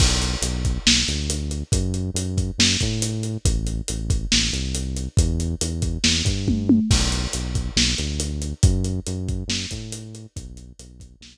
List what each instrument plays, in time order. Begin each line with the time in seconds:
0.00 synth bass 1 B1, kick, crash
0.22 closed hi-hat
0.42 synth bass 1 B1, closed hi-hat
0.65 kick, closed hi-hat
0.86 synth bass 1 B1, snare
1.08 synth bass 1 D2, closed hi-hat
1.30 closed hi-hat
1.51 closed hi-hat
1.72 synth bass 1 F#2, kick, closed hi-hat
1.94 closed hi-hat
2.14 synth bass 1 F#2, closed hi-hat
2.38 kick, closed hi-hat
2.58 synth bass 1 F#2, snare
2.80 synth bass 1 A2, kick, closed hi-hat
3.02 closed hi-hat
3.23 closed hi-hat
3.45 synth bass 1 A1, kick, closed hi-hat
3.67 closed hi-hat
3.88 synth bass 1 A1, closed hi-hat
4.10 kick, closed hi-hat
4.32 synth bass 1 A1, snare
4.53 synth bass 1 C2, closed hi-hat
4.75 closed hi-hat
4.96 closed hi-hat
5.17 synth bass 1 E2, kick, closed hi-hat
5.40 closed hi-hat
5.61 synth bass 1 E2, closed hi-hat
5.82 kick, closed hi-hat
6.04 synth bass 1 E2, snare
6.25 synth bass 1 G2, kick, closed hi-hat
6.48 kick, high tom
6.69 high tom
6.90 synth bass 1 B1, kick, crash
7.12 closed hi-hat
7.33 synth bass 1 B1, closed hi-hat
7.55 kick, closed hi-hat
7.76 synth bass 1 B1, snare
7.98 synth bass 1 D2, closed hi-hat
8.20 closed hi-hat
8.42 closed hi-hat
8.63 synth bass 1 F#2, kick, closed hi-hat
8.84 closed hi-hat
9.07 synth bass 1 F#2, closed hi-hat
9.29 kick, closed hi-hat
9.48 synth bass 1 F#2, snare
9.71 synth bass 1 A2, kick, closed hi-hat
9.92 closed hi-hat
10.15 closed hi-hat
10.36 synth bass 1 B1, kick, closed hi-hat
10.57 closed hi-hat
10.79 synth bass 1 B1, closed hi-hat
11.00 kick, closed hi-hat
11.21 synth bass 1 B1, snare